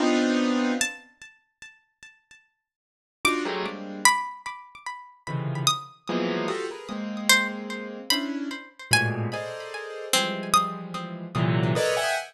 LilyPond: <<
  \new Staff \with { instrumentName = "Acoustic Grand Piano" } { \time 5/8 \tempo 4 = 74 <b c' d' ees' f'>4 r4. | r4. <d' ees' f' ges'>16 <ges g aes a bes>16 <g aes bes c' d'>8 | r4. <c des d ees e f>8 r8 | <e f ges aes bes b>8 <f' ges' g' a'>16 <aes' bes' b'>16 <aes bes c'>4. |
<des' d' e'>8 r8 <aes, a, bes, b,>8 <aes' a' bes' c'' d'' ees''>4 | <e f g aes>4. <bes, c d e ges>8 <a' bes' b' des'' d'' ees''>16 <e'' ges'' g'' aes''>16 | }
  \new Staff \with { instrumentName = "Pizzicato Strings" } { \time 5/8 r4 a''8 r4 | r4. d'''4 | b''8 r4. ees'''8 | r4. c''16 r8. |
b''4 aes''4 r8 | c'8 ees'''4 r4 | }
>>